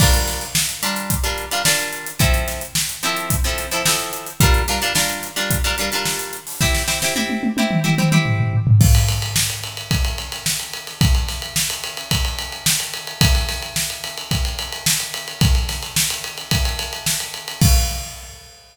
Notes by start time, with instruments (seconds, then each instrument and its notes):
0.00 acoustic guitar (steel) G3 D4 F4 A#4, kick, crash
0.14 closed hi-hat
0.28 snare, closed hi-hat
0.41 snare, closed hi-hat
0.55 snare
0.69 closed hi-hat
0.83 acoustic guitar (steel) G3 D4 F4 A#4, snare, closed hi-hat
0.96 closed hi-hat
1.10 kick, closed hi-hat
1.24 acoustic guitar (steel) G3 D4 F4 A#4, closed hi-hat
1.38 closed hi-hat
1.51 acoustic guitar (steel) G3 D4 F4 A#4, closed hi-hat
1.65 acoustic guitar (steel) G3 D4 F4 A#4, snare
1.79 closed hi-hat
1.93 closed hi-hat
2.07 closed hi-hat
2.19 acoustic guitar (steel) F3 C4 E4 A4, kick, closed hi-hat
2.34 closed hi-hat
2.48 snare, closed hi-hat
2.61 closed hi-hat
2.75 snare
2.89 closed hi-hat
3.03 acoustic guitar (steel) F3 C4 E4 A4, closed hi-hat
3.17 closed hi-hat
3.30 kick, closed hi-hat
3.44 acoustic guitar (steel) F3 C4 E4 A4, closed hi-hat
3.58 snare, closed hi-hat
3.71 acoustic guitar (steel) F3 C4 E4 A4, closed hi-hat
3.85 acoustic guitar (steel) F3 C4 E4 A4, snare
3.99 closed hi-hat
4.13 closed hi-hat
4.26 closed hi-hat
4.40 acoustic guitar (steel) G3 D4 F4 A#4, kick, closed hi-hat
4.54 closed hi-hat
4.68 acoustic guitar (steel) G3 D4 F4 A#4, snare, closed hi-hat
4.82 acoustic guitar (steel) G3 D4 F4 A#4, closed hi-hat
4.95 acoustic guitar (steel) G3 D4 F4 A#4, snare
5.09 closed hi-hat
5.23 snare, closed hi-hat
5.36 acoustic guitar (steel) G3 D4 F4 A#4, closed hi-hat
5.50 kick, closed hi-hat
5.64 acoustic guitar (steel) G3 D4 F4 A#4, closed hi-hat
5.78 acoustic guitar (steel) G3 D4 F4 A#4, closed hi-hat
5.92 acoustic guitar (steel) G3 D4 F4 A#4, snare, closed hi-hat
6.05 snare
6.19 closed hi-hat
6.33 closed hi-hat
6.47 open hi-hat
6.61 acoustic guitar (steel) C4 E4 G4, kick, snare
6.74 snare
6.88 acoustic guitar (steel) C4 E4 G4, snare
7.02 acoustic guitar (steel) C4 E4 G4, snare
7.16 acoustic guitar (steel) C4 E4 G4, high tom
7.29 high tom
7.43 high tom
7.57 acoustic guitar (steel) C4 E4 G4, high tom
7.71 mid tom
7.84 acoustic guitar (steel) C4 E4 G4, mid tom
7.98 acoustic guitar (steel) C4 E4 G4, mid tom
8.12 acoustic guitar (steel) C4 E4 G4, mid tom
8.26 floor tom
8.39 floor tom
8.53 floor tom
8.67 floor tom
8.81 kick, crash
8.95 ride
9.08 snare, ride
9.22 ride
9.36 snare
9.50 ride
9.63 ride
9.77 ride
9.91 kick, ride
10.05 ride
10.18 ride
10.32 snare, ride
10.46 snare
10.60 ride
10.73 ride
10.87 snare, ride
11.01 kick, ride
11.15 ride
11.28 snare, ride
11.42 ride
11.56 snare
11.70 snare, ride
11.84 ride
11.97 ride
12.11 kick, ride
12.25 ride
12.39 ride
12.52 ride
12.66 snare
12.80 ride
12.94 ride
13.07 ride
13.21 kick, ride
13.35 snare, ride
13.49 snare, ride
13.62 ride
13.76 snare
13.90 ride
14.04 snare, ride
14.17 ride
14.31 kick, ride
14.45 ride
14.59 ride
14.72 ride
14.86 snare
15.00 ride
15.14 ride
15.28 ride
15.41 kick, ride
15.55 ride
15.69 snare, ride
15.82 snare, ride
15.96 snare
16.10 ride
16.24 ride
16.38 ride
16.51 kick, ride
16.65 snare, ride
16.79 snare, ride
16.93 ride
17.06 snare
17.20 ride
17.34 ride
17.48 ride
17.61 kick, crash